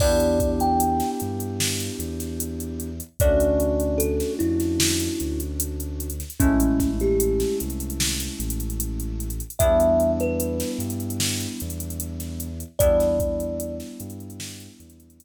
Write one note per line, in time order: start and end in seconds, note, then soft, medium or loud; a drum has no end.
0.00 1.02 E2 loud
0.00 2.89 B3 medium
0.00 2.89 D4 loud
0.00 2.89 E4 medium
0.00 2.89 G4 medium
0.00 0.51 D5 medium
0.00 kick loud
0.00 crash loud
0.20 closed hi-hat medium
0.40 kick loud
0.40 closed hi-hat medium
0.60 1.10 G5 medium
0.60 closed hi-hat medium
0.80 closed hi-hat loud
1.00 snare medium
1.00 closed hi-hat medium
1.20 1.90 G2 loud
1.20 closed hi-hat medium
1.40 closed hi-hat medium
1.60 snare loud
1.80 closed hi-hat medium
1.99 3.01 E2 medium
1.99 closed hi-hat medium
2.20 snare soft
2.20 closed hi-hat medium
2.40 closed hi-hat loud
2.60 closed hi-hat medium
2.80 closed hi-hat medium
3.00 closed hi-hat medium
3.20 4.22 D2 loud
3.20 6.08 A3 medium
3.20 6.08 C#4 medium
3.20 6.08 D4 medium
3.20 6.08 F#4 medium
3.20 3.99 D5 medium
3.20 kick loud
3.20 closed hi-hat loud
3.40 closed hi-hat medium
3.60 closed hi-hat medium
3.80 closed hi-hat medium
3.98 4.33 A4 medium
3.98 closed hi-hat loud
4.20 snare medium
4.20 closed hi-hat medium
4.39 5.08 F2 loud
4.39 5.40 E4 medium
4.39 closed hi-hat medium
4.60 snare soft
4.60 closed hi-hat medium
4.80 snare loud
5.00 closed hi-hat medium
5.20 6.23 D2 medium
5.20 closed hi-hat medium
5.40 closed hi-hat medium
5.60 closed hi-hat loud
5.80 closed hi-hat medium
6.00 closed hi-hat medium
6.10 closed hi-hat medium
6.20 snare soft
6.20 closed hi-hat medium
6.30 closed hi-hat medium
6.40 7.44 A1 loud
6.40 9.28 G#3 medium
6.40 9.28 A3 loud
6.40 9.28 C#4 medium
6.40 6.91 C#4 medium
6.40 9.28 E4 medium
6.40 kick loud
6.40 closed hi-hat loud
6.60 closed hi-hat loud
6.80 kick medium
6.80 snare soft
6.80 closed hi-hat medium
7.00 7.56 G4 medium
7.00 closed hi-hat medium
7.20 closed hi-hat loud
7.40 snare medium
7.40 closed hi-hat medium
7.60 8.29 C2 medium
7.60 closed hi-hat medium
7.70 closed hi-hat medium
7.80 closed hi-hat medium
7.90 closed hi-hat medium
8.00 snare loud
8.20 closed hi-hat medium
8.40 9.42 A1 loud
8.40 closed hi-hat medium
8.50 closed hi-hat loud
8.60 closed hi-hat medium
8.70 closed hi-hat medium
8.80 closed hi-hat loud
9.00 closed hi-hat medium
9.20 closed hi-hat medium
9.30 closed hi-hat medium
9.40 closed hi-hat medium
9.50 closed hi-hat medium
9.59 10.63 E2 loud
9.59 12.48 G3 medium
9.59 12.48 B3 loud
9.59 12.48 D4 medium
9.59 12.48 E4 medium
9.59 10.11 E5 medium
9.59 kick loud
9.59 closed hi-hat loud
9.80 closed hi-hat medium
10.00 closed hi-hat medium
10.20 10.70 B4 medium
10.20 closed hi-hat medium
10.40 closed hi-hat loud
10.60 snare medium
10.60 closed hi-hat medium
10.79 11.46 G2 loud
10.79 closed hi-hat medium
10.90 closed hi-hat medium
11.00 closed hi-hat medium
11.10 closed hi-hat medium
11.20 snare loud
11.40 closed hi-hat medium
11.60 12.64 E2 loud
11.60 closed hi-hat medium
11.70 closed hi-hat medium
11.80 closed hi-hat medium
11.90 closed hi-hat medium
12.00 closed hi-hat loud
12.20 snare soft
12.20 closed hi-hat medium
12.40 closed hi-hat medium
12.60 closed hi-hat medium
12.79 13.82 E2 loud
12.79 15.24 G3 medium
12.79 15.24 B3 medium
12.79 15.24 D4 medium
12.79 15.24 E4 medium
12.79 13.77 D5 medium
12.79 kick loud
12.79 closed hi-hat loud
13.00 snare soft
13.00 closed hi-hat medium
13.20 kick loud
13.20 closed hi-hat medium
13.40 closed hi-hat medium
13.60 closed hi-hat loud
13.80 snare medium
13.80 closed hi-hat medium
14.00 14.68 G2 loud
14.00 closed hi-hat loud
14.10 closed hi-hat medium
14.20 closed hi-hat medium
14.30 closed hi-hat medium
14.40 snare loud
14.60 closed hi-hat medium
14.80 15.24 E2 loud
14.80 closed hi-hat medium
14.90 closed hi-hat medium
15.00 closed hi-hat medium
15.10 closed hi-hat medium
15.20 closed hi-hat loud